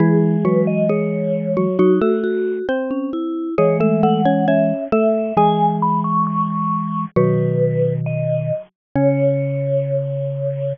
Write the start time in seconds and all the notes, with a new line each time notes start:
0.00 E3 G#3 E4 G#4
0.45 F#3 F#4 B4
0.67 D#5
0.89 G#3 G#4 C#5
1.57 F#3 F#4
1.79 F#3 D#4 F#4
2.01 A3 F#4 A4
2.24 F#4
2.69 C4 C5
2.91 C#4
3.13 E4
3.58 E3 G#3 G#4 C#5
3.80 A3 A4 E5
4.03 A3 A4 F#5
4.25 C#4 C#5
4.48 C#4 C#5 E5
4.92 A3 A4 E5
5.37 E3 G#3 G#4 G#5
5.82 B5
6.04 C#6
6.27 C#6
7.16 B2 D#3 F#3 F#4 B4
8.06 D#5
8.95 C#3 C#4 C#5